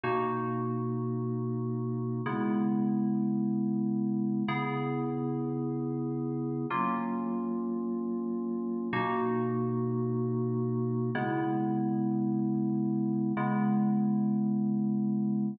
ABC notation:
X:1
M:4/4
L:1/8
Q:1/4=108
K:C#dor
V:1 name="Electric Piano 2"
[B,,A,DF]8 | [C,G,B,E]8 | [C,B,EG]8 | [F,A,C^E]8 |
[B,,A,DF]8 | [C,G,B,E]8 | [C,G,B,E]8 |]